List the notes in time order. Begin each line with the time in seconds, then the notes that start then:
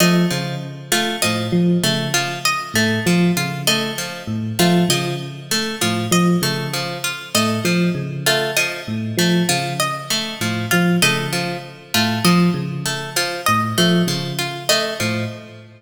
0.00 F3 A3 D#5
0.30 C#3 F3
0.92 A3 F4
1.22 A2 F3 D#5
1.52 F3
1.84 C#3 A3
2.14 F3 F4
2.45 D#5
2.74 A2 A3
3.06 F3
3.37 C#3 F4
3.67 A3 D#5
3.98 F3
4.27 A2
4.59 F3 A3 F4
4.89 C#3 F3 D#5
5.51 A3
5.81 A2 F3 F4
6.11 F3 D#5
6.42 C#3 A3
6.73 F3
7.04 F4
7.35 A2 A3 D#5
7.64 F3
7.95 C#3
8.26 A3 F4
8.57 F3 D#5
8.88 A2
9.17 F3 A3
9.49 C#3 F3 F4
9.80 D#5
10.10 A3
10.41 A2 F3
10.71 F3 F4
11.02 C#3 A3 D#5
11.33 F3
11.94 A2 A3 F4
12.24 F3 D#5
12.54 C#3
12.86 A3
13.16 F3 F4
13.46 A2 D#5
13.78 F3 A3
14.07 C#3 F3
14.39 F4
14.69 A3 D#5
15.00 A2 F3